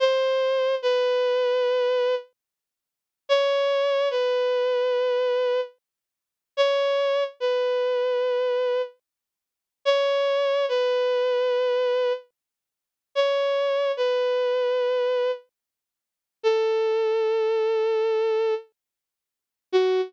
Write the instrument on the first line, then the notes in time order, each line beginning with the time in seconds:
violin
0.00 C5
0.82 B4
3.29 C#5
4.11 B4
6.57 C#5
7.40 B4
9.85 C#5
10.69 B4
13.15 C#5
13.97 B4
16.43 A4
19.72 F#4